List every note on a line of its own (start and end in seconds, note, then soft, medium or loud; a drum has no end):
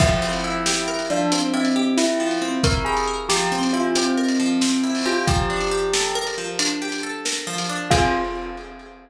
0.00 1.09 F3 loud
0.00 0.94 E4 medium
0.00 kick loud
0.00 crash loud
0.22 1.32 C4 loud
0.33 closed hi-hat medium
0.44 1.53 E4 medium
0.66 1.75 G4 medium
0.66 snare loud
0.88 1.98 A#4 medium
0.99 closed hi-hat medium
1.10 2.19 F3 medium
1.10 1.31 D4 medium
1.32 2.41 C4 medium
1.32 closed hi-hat loud
1.54 1.89 C4 medium
1.54 2.63 E4 medium
1.65 closed hi-hat medium
1.76 2.85 G4 medium
1.97 2.35 E4 medium
1.97 3.07 A#4 medium
1.97 snare loud
2.20 3.29 F3 medium
2.31 closed hi-hat medium
2.42 3.51 C4 medium
2.64 3.73 E4 medium
2.64 2.85 A#4 medium
2.64 kick loud
2.64 closed hi-hat loud
2.85 3.95 G4 medium
2.85 3.06 G#4 medium
2.97 closed hi-hat medium
3.08 4.17 A#4 medium
3.29 4.39 F3 medium
3.29 3.48 G4 medium
3.29 snare loud
3.52 4.61 C4 medium
3.63 closed hi-hat medium
3.73 4.83 E4 medium
3.73 3.94 F4 medium
3.95 4.95 C4 medium
3.95 5.05 G4 medium
3.95 closed hi-hat loud
4.17 5.22 A#4 medium
4.28 closed hi-hat medium
4.40 5.23 F3 medium
4.61 5.24 C4 medium
4.61 snare loud
4.84 5.25 E4 medium
4.95 open hi-hat medium
5.06 5.25 F4 medium
5.06 5.26 G4 medium
5.27 6.37 F3 loud
5.27 6.17 G4 medium
5.27 kick loud
5.27 closed hi-hat medium
5.50 6.59 D4 medium
5.61 closed hi-hat medium
5.71 6.81 G4 medium
5.93 7.03 A4 medium
5.93 snare loud
6.15 7.25 A#4 loud
6.27 closed hi-hat medium
6.38 7.46 F3 medium
6.59 7.69 D4 medium
6.59 closed hi-hat loud
6.82 7.86 G4 medium
6.92 closed hi-hat medium
7.03 7.87 A4 loud
7.25 7.88 A#4 medium
7.25 snare loud
7.47 7.89 F3 medium
7.58 closed hi-hat medium
7.69 7.90 D4 medium
7.90 8.14 F3 loud
7.90 8.14 C4 loud
7.90 8.14 F4 loud
7.90 8.14 G#4 loud
7.90 kick loud
7.90 crash loud